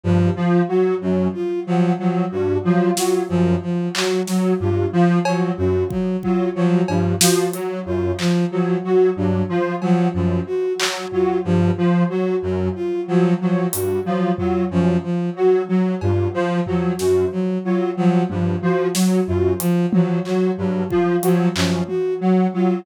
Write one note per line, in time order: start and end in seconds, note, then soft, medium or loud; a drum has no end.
0.04 0.30 G2 medium
0.04 0.30 F3 medium
0.36 0.62 F3 medium
0.68 0.95 F#3 medium
0.68 0.94 F#4 medium
1.01 1.28 F#2 medium
1.01 1.28 F#3 medium
1.34 1.60 F4 medium
1.67 1.93 F3 medium
1.67 1.93 F#3 medium
1.99 2.25 F3 medium
1.99 2.25 F#3 medium
2.32 2.58 G2 medium
2.32 2.58 F#4 medium
2.64 2.91 F3 medium
2.64 2.90 F#3 medium
2.97 3.23 F#3 medium
2.97 3.23 F4 medium
2.97 snare medium
3.29 3.56 F#2 medium
3.29 3.55 F3 medium
3.63 3.89 F3 medium
3.95 4.21 F#3 medium
3.95 4.21 F#4 medium
3.95 clap loud
4.27 4.53 F#3 medium
4.27 4.54 F#3 medium
4.27 snare medium
4.60 4.86 G2 medium
4.60 4.86 F4 medium
4.93 5.19 F3 medium
5.25 5.52 F3 medium
5.25 5.52 F#3 medium
5.25 cowbell loud
5.57 5.84 F#2 medium
5.57 5.83 F#4 medium
5.90 6.17 F#3 medium
5.90 kick medium
6.23 6.49 F#3 medium
6.23 6.49 F4 medium
6.23 kick medium
6.55 6.82 F3 medium
6.55 6.81 F#3 medium
6.88 7.15 G2 medium
6.88 7.14 F3 medium
6.88 cowbell medium
7.21 7.47 F3 medium
7.21 7.47 F#4 medium
7.21 snare loud
7.53 7.79 F#3 medium
7.53 7.80 F#3 medium
7.53 closed hi-hat medium
7.86 8.12 F#2 medium
7.86 8.12 F4 medium
8.19 8.45 F3 medium
8.19 clap medium
8.51 8.77 F3 medium
8.51 8.77 F#3 medium
8.84 9.10 F#3 medium
8.84 9.10 F#4 medium
9.16 9.43 G2 medium
9.16 9.43 F#3 medium
9.49 9.75 F3 medium
9.49 9.75 F4 medium
9.82 10.08 F3 medium
9.82 10.08 F#3 medium
9.82 cowbell medium
10.14 10.40 F#2 medium
10.14 10.40 F3 medium
10.47 10.73 F#4 medium
10.79 11.05 F#3 medium
10.79 clap loud
11.12 11.38 F#3 medium
11.12 11.38 F4 medium
11.12 floor tom medium
11.45 11.71 G2 medium
11.45 11.71 F3 medium
11.78 12.04 F3 medium
12.10 12.36 F#3 medium
12.10 12.36 F#4 medium
12.43 12.69 F#2 medium
12.43 12.69 F#3 medium
12.75 13.01 F4 medium
13.08 13.34 F3 medium
13.08 13.34 F#3 medium
13.41 13.67 F3 medium
13.41 13.67 F#3 medium
13.73 13.99 G2 medium
13.73 13.99 F#4 medium
13.73 closed hi-hat loud
14.05 14.32 F3 medium
14.05 14.32 F#3 medium
14.38 14.65 F#3 medium
14.38 14.64 F4 medium
14.38 floor tom medium
14.71 14.97 F#2 medium
14.71 14.97 F3 medium
15.04 15.30 F3 medium
15.36 15.62 F#3 medium
15.36 15.63 F#4 medium
15.69 15.95 F#3 medium
16.01 16.28 G2 medium
16.01 16.28 F4 medium
16.01 cowbell medium
16.34 16.60 F3 medium
16.67 16.93 F3 medium
16.67 16.93 F#3 medium
16.67 floor tom medium
16.99 17.25 F#2 medium
16.99 17.25 F#4 medium
16.99 snare medium
17.32 17.58 F#3 medium
17.64 17.91 F#3 medium
17.64 17.90 F4 medium
17.97 18.23 F3 medium
17.97 18.23 F#3 medium
18.30 18.56 G2 medium
18.30 18.56 F3 medium
18.30 high tom medium
18.62 18.88 F3 medium
18.62 18.89 F#4 medium
18.94 19.21 F#3 medium
18.94 snare medium
19.27 19.54 F#2 medium
19.27 19.53 F4 medium
19.60 19.86 F3 medium
19.60 closed hi-hat medium
19.93 20.19 F3 medium
19.93 20.19 F#3 medium
19.93 high tom loud
20.25 20.51 F#3 medium
20.25 20.51 F#4 medium
20.25 clap soft
20.58 20.84 G2 medium
20.58 20.84 F#3 medium
20.90 21.17 F3 medium
20.90 21.16 F4 medium
20.90 kick medium
21.23 21.49 F3 medium
21.23 21.49 F#3 medium
21.23 closed hi-hat medium
21.56 21.82 F#2 medium
21.56 21.82 F3 medium
21.56 clap loud
21.88 22.14 F#4 medium
21.88 high tom medium
22.21 22.47 F#3 medium
22.54 22.80 F#3 medium
22.54 22.80 F4 medium